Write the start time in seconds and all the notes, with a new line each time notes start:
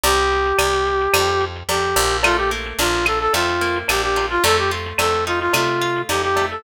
0.04 C2 G4, cowbell, shaker
0.17 shaker
0.31 shaker
0.45 shaker
0.58 C2, cowbell, claves, shaker
0.72 shaker
0.85 shaker
1.00 shaker
1.14 F2, cowbell, claves, shaker
1.27 shaker
1.40 shaker
1.55 shaker
1.69 F2 G4, tambourine, cowbell, shaker
1.83 shaker
1.96 A#1, cowbell, shaker
2.10 shaker
2.23 A3 F4, cowbell, claves, shaker
2.37 G4, shaker
2.51 A#3, shaker
2.65 shaker
2.79 A#1 D4 F4, tambourine, cowbell, shaker
2.93 shaker
3.06 F4 A4, claves, shaker
3.20 A4
3.33 F2 A3 F4, cowbell, shaker
3.48 shaker
3.61 A#3, shaker
3.75 shaker
3.88 A#1 D4 G4, tambourine, cowbell, claves, shaker
4.03 G4, shaker
4.16 F4, cowbell, shaker
4.30 F4, shaker
4.44 F2 A3 A4, cowbell, shaker
4.56 G4, shaker
4.71 F4, shaker
4.85 shaker
4.98 F2 A3 A4, tambourine, cowbell, claves, shaker
5.13 shaker
5.26 D#4 F4, shaker
5.40 F4, shaker
5.53 C3 A3 F4, cowbell, claves, shaker
5.66 shaker
5.81 F4, shaker
5.95 shaker
6.09 F2 D#4 G4, tambourine, cowbell, shaker
6.23 G4, shaker
6.36 A3, cowbell, shaker
6.50 A4, shaker